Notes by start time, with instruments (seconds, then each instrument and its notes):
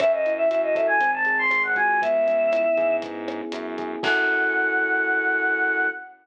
0.00 synth bass 1 F#2, electric piano 1 C#4, choir aahs E5, kick, cross-stick, closed hi-hat
0.13 choir aahs D#5
0.26 electric piano 1 E4, closed hi-hat
0.38 choir aahs E5
0.49 synth bass 1 F#2, electric piano 1 F#4, choir aahs E5, closed hi-hat
0.63 choir aahs D#5
0.75 electric piano 1 A4, choir aahs E5, kick, cross-stick, closed hi-hat
0.87 choir aahs G#5
1.00 synth bass 1 G#1, electric piano 1 C4, kick, closed hi-hat
1.14 choir aahs A5
1.25 electric piano 1 G#4, closed hi-hat
1.39 choir aahs C6
1.51 synth bass 1 G#1, electric piano 1 C4, cross-stick, closed hi-hat
1.63 choir aahs F#5
1.76 synth bass 1 C#2, electric piano 1 F#4, choir aahs G#5, kick, closed hi-hat
2.02 electric piano 1 B3, choir aahs E5, kick, closed hi-hat
2.27 electric piano 1 C#4, closed hi-hat
2.52 electric piano 1 E4, cross-stick, closed hi-hat
2.77 synth bass 1 G#2, electric piano 1 G#4, kick, closed hi-hat
3.02 electric piano 1 B3, kick, closed hi-hat
3.28 electric piano 1 C#4, cross-stick, closed hi-hat
3.52 synth bass 1 F#2, electric piano 1 E4, closed hi-hat
3.78 electric piano 1 G#4, kick, closed hi-hat
4.03 synth bass 1 F#2, electric piano 1 C#4 E4 F#4 A4, choir aahs F#5, kick, crash